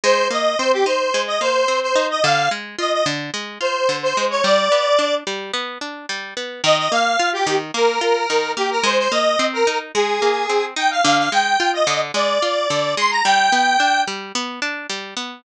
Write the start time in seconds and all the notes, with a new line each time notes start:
0.04 G#3 C5
0.31 A#3 D#5
0.59 C4 C5
0.72 G4
0.86 D#4 C5
1.14 G#3
1.27 D#5
1.41 A#3 C5
1.68 C4
1.82 C5
1.96 D#4
2.10 D#5
2.24 D3 F5
2.51 G#3
2.79 F4 D#5
2.93 D#5
3.06 D3
3.34 G#3
3.61 F4 C5
3.89 D3
4.03 C5
4.17 G#3
4.30 C#5
4.44 G3 D5
4.72 B3
4.99 D4
5.27 G3
5.54 B3
5.81 D4
6.09 G3
6.37 B3
6.64 D#3 D#5
6.78 D#5
6.92 A#3 F5
7.19 F4
7.33 G4
7.47 D#3
7.74 A#3 A#4
8.01 F4
8.30 D#3
8.57 A#3 G4
8.71 A#4
8.83 G#3 C5
8.98 C5
9.12 A#3 D#5
9.39 C4
9.53 A#4
9.67 D#4
9.94 G#3 G#4
10.22 A#3
10.50 C4
10.76 D#4 G5
10.91 F5
11.04 D3 F5
11.18 F5
11.32 G#3 G5
11.60 F4
11.73 D#5
11.87 D3
12.14 G#3 D5
12.42 F4
12.70 D3
12.97 G#3 C6
13.11 A#5
13.25 G3 G5
13.52 B3
13.80 D4
14.08 G3
14.35 B3
14.62 D4
14.90 G3
15.17 B3